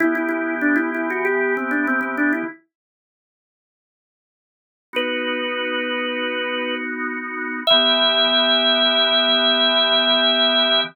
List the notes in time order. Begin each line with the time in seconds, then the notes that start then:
0.00 E3 B3 E4 G4
0.15 E4
0.29 E4
0.61 D4
0.76 E4
0.94 E4
1.10 F#4
1.25 G4
1.57 C4
1.71 D4
1.87 C4
2.01 C4
2.17 D4
2.33 E4
4.93 B3 D#4 F#4 B4
7.67 E3 B3 G4 E5